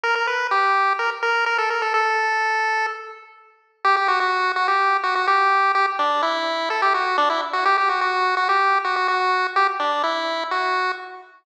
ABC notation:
X:1
M:4/4
L:1/16
Q:1/4=126
K:F
V:1 name="Lead 1 (square)"
B B =B2 G4 _B z B2 B A B A | A8 z8 | [K:G] G G F F3 F G3 F F G4 | G z D2 E4 A G F2 D E z F |
G G F F3 F G3 F F F4 | G z D2 E4 F4 z4 |]